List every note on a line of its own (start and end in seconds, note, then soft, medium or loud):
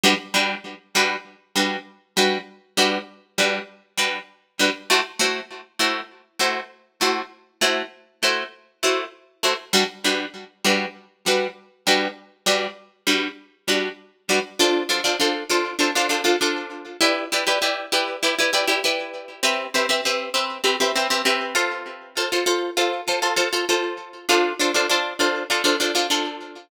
0.04 0.14 G3 loud
0.04 0.14 D4 loud
0.04 0.14 F#4 loud
0.04 0.14 B4 loud
0.34 0.55 G3 medium
0.34 0.55 D4 medium
0.34 0.55 F#4 medium
0.34 0.55 B4 medium
0.95 1.16 G3 medium
0.95 1.16 D4 medium
0.95 1.16 F#4 medium
0.95 1.16 B4 medium
1.56 1.77 G3 medium
1.56 1.77 D4 medium
1.56 1.77 F#4 medium
1.56 1.77 B4 medium
2.17 2.38 G3 medium
2.17 2.38 D4 medium
2.17 2.38 F#4 medium
2.17 2.38 B4 medium
2.77 2.98 G3 medium
2.77 2.98 D4 medium
2.77 2.98 F#4 medium
2.77 2.98 B4 medium
3.38 3.59 G3 medium
3.38 3.59 D4 medium
3.38 3.59 F#4 medium
3.38 3.59 B4 medium
3.97 4.19 G3 medium
3.97 4.19 D4 medium
3.97 4.19 F#4 medium
3.97 4.19 B4 medium
4.59 4.70 G3 medium
4.59 4.70 D4 medium
4.59 4.70 F#4 medium
4.59 4.70 B4 medium
4.90 5.01 A3 loud
4.90 5.01 E4 medium
4.90 5.01 F#4 medium
4.90 5.01 C5 medium
5.19 5.41 A3 medium
5.19 5.41 E4 medium
5.19 5.41 F#4 medium
5.19 5.41 C5 medium
5.79 6.01 A3 medium
5.79 6.01 E4 medium
5.79 6.01 F#4 medium
5.79 6.01 C5 medium
6.39 6.61 A3 medium
6.39 6.61 E4 medium
6.39 6.61 F#4 medium
6.39 6.61 C5 medium
7.01 7.22 A3 medium
7.01 7.22 E4 medium
7.01 7.22 F#4 medium
7.01 7.22 C5 medium
7.61 7.82 A3 medium
7.61 7.82 E4 medium
7.61 7.82 F#4 medium
7.61 7.82 C5 medium
8.23 8.44 A3 medium
8.23 8.44 E4 medium
8.23 8.44 F#4 medium
8.23 8.44 C5 medium
8.83 9.04 A3 medium
8.83 9.04 E4 medium
8.83 9.04 F#4 medium
8.83 9.04 C5 medium
9.43 9.54 A3 medium
9.43 9.54 E4 medium
9.43 9.54 F#4 medium
9.43 9.54 C5 medium
9.73 9.84 G3 loud
9.73 9.84 D4 loud
9.73 9.84 F#4 loud
9.73 9.84 B4 loud
10.04 10.26 G3 medium
10.04 10.26 D4 medium
10.04 10.26 F#4 medium
10.04 10.26 B4 medium
10.65 10.86 G3 medium
10.65 10.86 D4 medium
10.65 10.86 F#4 medium
10.65 10.86 B4 medium
11.26 11.47 G3 medium
11.26 11.47 D4 medium
11.26 11.47 F#4 medium
11.26 11.47 B4 medium
11.87 12.08 G3 medium
11.87 12.08 D4 medium
11.87 12.08 F#4 medium
11.87 12.08 B4 medium
12.46 12.67 G3 medium
12.46 12.67 D4 medium
12.46 12.67 F#4 medium
12.46 12.67 B4 medium
13.07 13.28 G3 medium
13.07 13.28 D4 medium
13.07 13.28 F#4 medium
13.07 13.28 B4 medium
13.68 13.89 G3 medium
13.68 13.89 D4 medium
13.68 13.89 F#4 medium
13.68 13.89 B4 medium
14.29 14.40 G3 medium
14.29 14.40 D4 medium
14.29 14.40 F#4 medium
14.29 14.40 B4 medium
14.59 14.84 D4 medium
14.59 14.84 F4 loud
14.59 14.84 A4 medium
14.59 14.84 C5 medium
14.89 15.01 D4 medium
14.89 15.01 F4 medium
14.89 15.01 A4 medium
14.89 15.01 C5 medium
15.04 15.16 D4 medium
15.04 15.16 F4 medium
15.04 15.16 A4 medium
15.04 15.16 C5 medium
15.20 15.44 D4 medium
15.20 15.44 F4 medium
15.20 15.44 A4 medium
15.20 15.44 C5 medium
15.49 15.74 D4 medium
15.49 15.74 F4 medium
15.49 15.74 A4 medium
15.49 15.74 C5 medium
15.79 15.91 D4 medium
15.79 15.91 F4 medium
15.79 15.91 A4 medium
15.79 15.91 C5 medium
15.95 16.07 D4 medium
15.95 16.07 F4 medium
15.95 16.07 A4 medium
15.95 16.07 C5 medium
16.09 16.21 D4 medium
16.09 16.21 F4 medium
16.09 16.21 A4 medium
16.09 16.21 C5 medium
16.24 16.36 D4 medium
16.24 16.36 F4 medium
16.24 16.36 A4 medium
16.24 16.36 C5 medium
16.41 16.89 D4 medium
16.41 16.89 F4 medium
16.41 16.89 A4 medium
16.41 16.89 C5 medium
17.01 17.25 E4 medium
17.01 17.25 G4 medium
17.01 17.25 B4 loud
17.01 17.25 D5 medium
17.32 17.44 E4 medium
17.32 17.44 G4 medium
17.32 17.44 B4 medium
17.32 17.44 D5 medium
17.47 17.59 E4 medium
17.47 17.59 G4 medium
17.47 17.59 B4 medium
17.47 17.59 D5 medium
17.62 17.86 E4 medium
17.62 17.86 G4 medium
17.62 17.86 B4 medium
17.62 17.86 D5 medium
17.92 18.16 E4 medium
17.92 18.16 G4 medium
17.92 18.16 B4 medium
17.92 18.16 D5 medium
18.23 18.35 E4 medium
18.23 18.35 G4 medium
18.23 18.35 B4 medium
18.23 18.35 D5 medium
18.39 18.51 E4 medium
18.39 18.51 G4 medium
18.39 18.51 B4 medium
18.39 18.51 D5 medium
18.53 18.65 E4 medium
18.53 18.65 G4 medium
18.53 18.65 B4 medium
18.53 18.65 D5 medium
18.67 18.80 E4 medium
18.67 18.80 G4 medium
18.67 18.80 B4 medium
18.67 18.80 D5 medium
18.84 19.32 E4 medium
18.84 19.32 G4 medium
18.84 19.32 B4 medium
18.84 19.32 D5 medium
19.43 19.67 C4 loud
19.43 19.67 G4 loud
19.43 19.67 B4 medium
19.43 19.67 E5 medium
19.74 19.86 C4 medium
19.74 19.86 G4 medium
19.74 19.86 B4 medium
19.74 19.86 E5 medium
19.89 20.01 C4 medium
19.89 20.01 G4 medium
19.89 20.01 B4 medium
19.89 20.01 E5 medium
20.05 20.29 C4 medium
20.05 20.29 G4 medium
20.05 20.29 B4 medium
20.05 20.29 E5 medium
20.34 20.58 C4 medium
20.34 20.58 G4 medium
20.34 20.58 B4 medium
20.34 20.58 E5 medium
20.64 20.76 C4 medium
20.64 20.76 G4 medium
20.64 20.76 B4 medium
20.64 20.76 E5 medium
20.80 20.92 C4 medium
20.80 20.92 G4 medium
20.80 20.92 B4 medium
20.80 20.92 E5 medium
20.95 21.08 C4 medium
20.95 21.08 G4 medium
20.95 21.08 B4 medium
20.95 21.08 E5 medium
21.10 21.22 C4 medium
21.10 21.22 G4 medium
21.10 21.22 B4 medium
21.10 21.22 E5 medium
21.25 21.54 C4 medium
21.25 21.54 G4 medium
21.25 21.54 B4 medium
21.25 21.54 E5 medium
21.55 22.09 F4 medium
21.55 22.09 A4 medium
21.55 22.09 C5 medium
22.17 22.29 F4 medium
22.17 22.29 A4 medium
22.17 22.29 C5 medium
22.32 22.44 F4 medium
22.32 22.44 A4 medium
22.32 22.44 C5 medium
22.46 22.70 F4 medium
22.46 22.70 A4 medium
22.46 22.70 C5 medium
22.77 23.01 F4 medium
22.77 23.01 A4 medium
22.77 23.01 C5 medium
23.08 23.20 F4 medium
23.08 23.20 A4 medium
23.08 23.20 C5 medium
23.22 23.34 F4 medium
23.22 23.34 A4 medium
23.22 23.34 C5 medium
23.36 23.48 F4 medium
23.36 23.48 A4 medium
23.36 23.48 C5 medium
23.53 23.65 F4 medium
23.53 23.65 A4 medium
23.53 23.65 C5 medium
23.69 24.17 F4 medium
23.69 24.17 A4 medium
23.69 24.17 C5 medium
24.29 24.53 D4 medium
24.29 24.53 F4 loud
24.29 24.53 A4 medium
24.29 24.53 C5 medium
24.59 24.72 D4 medium
24.59 24.72 F4 medium
24.59 24.72 A4 medium
24.59 24.72 C5 medium
24.74 24.86 D4 medium
24.74 24.86 F4 medium
24.74 24.86 A4 medium
24.74 24.86 C5 medium
24.89 25.14 D4 medium
24.89 25.14 F4 medium
24.89 25.14 A4 medium
24.89 25.14 C5 medium
25.19 25.43 D4 medium
25.19 25.43 F4 medium
25.19 25.43 A4 medium
25.19 25.43 C5 medium
25.50 25.62 D4 medium
25.50 25.62 F4 medium
25.50 25.62 A4 medium
25.50 25.62 C5 medium
25.64 25.76 D4 medium
25.64 25.76 F4 medium
25.64 25.76 A4 medium
25.64 25.76 C5 medium
25.80 25.92 D4 medium
25.80 25.92 F4 medium
25.80 25.92 A4 medium
25.80 25.92 C5 medium
25.95 26.07 D4 medium
25.95 26.07 F4 medium
25.95 26.07 A4 medium
25.95 26.07 C5 medium
26.10 26.58 D4 medium
26.10 26.58 F4 medium
26.10 26.58 A4 medium
26.10 26.58 C5 medium